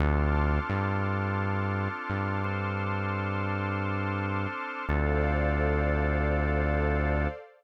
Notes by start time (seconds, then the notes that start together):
0.00 D2 C4 D4 F4 A4 A5 C6 D6 F6
0.69 G2
2.10 G2
2.44 C4 D4 A4 C5
4.89 D2 C4 D4 F4 A4 C5 D5 F5